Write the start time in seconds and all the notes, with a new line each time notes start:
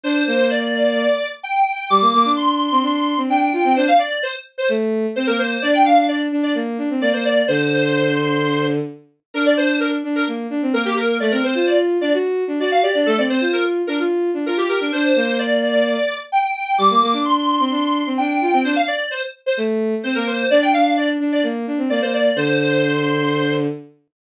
0.03 D4 C5
0.27 A#3
0.50 D5
1.43 G5
1.90 G3 D6
2.01 A#3
2.14 A#3
2.25 D4
2.36 C6
2.72 C4
2.83 D4
3.17 C4
3.29 D4 G5
3.53 F4
3.65 C4
3.76 D4 C5
3.88 F5
3.99 D5
4.23 C5
4.58 C5
4.69 A3
5.16 C4 C5
5.27 A#3 A#4
5.39 C5
5.62 D4 D5
5.74 G5
5.85 D4 F5
6.08 D5
6.32 D4
6.43 D5
6.55 A#3
6.78 D4
6.90 C4
7.01 A#3 D5
7.13 A#3 C5
7.25 D5
7.48 D3 C5
9.34 D4 A#4
9.46 D5
9.57 D4 C5
9.80 A#4
10.04 D4
10.16 A#4
10.27 A#3
10.50 D4
10.62 C4
10.73 A#3 A#4
10.85 A#3 G4
10.97 A#4
11.20 A3 D5
11.31 C4 A#4
11.43 C4 C5
11.55 F4
11.67 D5
12.01 D4 D5
12.14 F#4
12.48 D4
12.59 F#4 D5
12.71 F5
12.82 G4 D5
12.95 D4
13.06 A3 A4
13.18 C4 D5
13.29 C4 C5
13.41 F4
13.53 A#4
13.87 D4 A#4
13.99 F4
14.34 D4
14.46 F4 A#4
14.57 G4
14.69 G4 A#4
14.80 D4
14.92 D4 C5
15.16 A#3
15.39 D5
16.32 G5
16.78 G3 D6
16.90 A#3
17.02 A#3
17.13 D4
17.25 C6
17.60 C4
17.71 D4
18.06 C4
18.18 D4 G5
18.41 F4
18.53 C4
18.64 D4 C5
18.76 F5
18.88 D5
19.11 C5
19.46 C5
19.57 A3
20.03 C4 C5
20.15 A#3 A#4
20.27 C5
20.50 D4 D5
20.62 G5
20.73 D4 F5
20.97 D5
21.20 D4
21.32 D5
21.43 A#3
21.67 D4
21.78 C4
21.90 A#3 D5
22.01 A#3 C5
22.14 D5
22.36 D3 C5